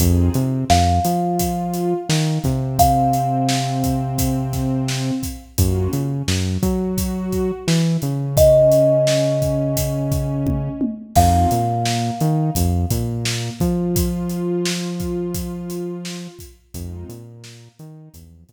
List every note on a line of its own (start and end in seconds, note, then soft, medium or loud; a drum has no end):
0.00 0.29 F2 loud
0.00 0.32 C4 loud
0.00 0.32 D#4 medium
0.00 0.32 F4 medium
0.00 0.32 G#4 loud
0.00 kick loud
0.00 closed hi-hat loud
0.34 0.65 C3 medium
0.34 0.64 C4 medium
0.34 closed hi-hat medium
0.70 1.00 F2 medium
0.70 0.99 F3 medium
0.70 2.78 F5 medium
0.70 snare loud
1.05 1.94 F3 medium
1.05 1.94 F4 medium
1.05 closed hi-hat medium
1.39 kick medium
1.39 closed hi-hat loud
1.74 closed hi-hat medium
2.09 2.39 D#3 medium
2.09 2.39 D#4 medium
2.09 snare loud
2.44 5.11 C3 medium
2.44 5.11 C4 medium
2.44 kick medium
2.44 snare soft
2.44 closed hi-hat medium
2.79 5.44 F5 medium
2.79 kick loud
2.79 closed hi-hat loud
3.13 closed hi-hat medium
3.49 snare loud
3.84 kick medium
3.84 closed hi-hat medium
4.18 kick loud
4.18 closed hi-hat loud
4.53 kick medium
4.53 snare soft
4.53 closed hi-hat medium
4.88 snare loud
5.23 kick medium
5.23 closed hi-hat medium
5.58 5.88 F#2 medium
5.58 5.90 A#3 medium
5.58 5.90 C#4 medium
5.58 5.90 F4 medium
5.58 5.90 F#4 medium
5.58 kick loud
5.58 closed hi-hat loud
5.93 6.23 C#3 medium
5.93 6.23 C#4 medium
5.93 closed hi-hat medium
6.28 6.58 F#2 medium
6.28 6.58 F#3 medium
6.28 snare loud
6.62 7.51 F#3 medium
6.62 7.52 F#4 medium
6.62 kick loud
6.62 closed hi-hat medium
6.98 kick medium
6.98 closed hi-hat loud
7.32 kick medium
7.32 closed hi-hat medium
7.67 7.97 E3 medium
7.67 7.96 E4 medium
7.67 snare loud
8.02 10.69 C#3 medium
8.02 10.69 C#4 medium
8.02 closed hi-hat medium
8.37 10.92 D#5 medium
8.37 kick loud
8.37 closed hi-hat loud
8.72 closed hi-hat medium
9.07 snare loud
9.42 kick medium
9.42 closed hi-hat medium
9.77 kick medium
9.77 closed hi-hat loud
10.12 kick loud
10.12 closed hi-hat medium
10.47 kick loud
10.47 high tom medium
10.81 high tom loud
11.16 11.46 F2 medium
11.16 11.48 G#3 medium
11.16 11.48 C4 loud
11.16 11.48 D#4 medium
11.16 11.48 F4 medium
11.16 13.90 F5 medium
11.16 kick loud
11.16 crash loud
11.51 12.11 A#2 medium
11.51 12.11 A#3 medium
11.51 closed hi-hat medium
11.85 snare loud
12.20 12.50 D#3 medium
12.20 12.51 D#4 medium
12.20 closed hi-hat medium
12.55 12.86 F2 medium
12.55 12.86 F3 medium
12.55 kick medium
12.55 closed hi-hat loud
12.90 13.50 A#2 medium
12.90 13.50 A#3 medium
12.90 kick medium
12.90 closed hi-hat loud
13.25 snare loud
13.60 16.28 F3 medium
13.60 16.27 F4 medium
13.60 kick medium
13.60 closed hi-hat medium
13.96 kick loud
13.96 closed hi-hat loud
14.30 closed hi-hat medium
14.65 snare loud
15.00 kick medium
15.00 closed hi-hat medium
15.34 kick loud
15.34 closed hi-hat loud
15.70 closed hi-hat medium
16.05 snare loud
16.39 kick medium
16.39 closed hi-hat medium
16.74 17.04 F2 medium
16.74 17.07 G#3 loud
16.74 17.07 C4 medium
16.74 17.07 D#4 loud
16.74 17.07 F4 medium
16.74 kick loud
16.74 closed hi-hat loud
17.09 17.68 A#2 medium
17.09 17.68 A#3 medium
17.09 closed hi-hat medium
17.44 snare loud
17.79 18.09 D#3 medium
17.79 18.09 D#4 medium
17.79 closed hi-hat medium
18.14 18.44 E2 medium
18.14 18.43 F3 medium
18.14 kick medium
18.14 closed hi-hat loud
18.48 18.53 A#2 medium
18.48 18.53 A#3 medium
18.48 kick medium
18.48 snare soft
18.48 closed hi-hat medium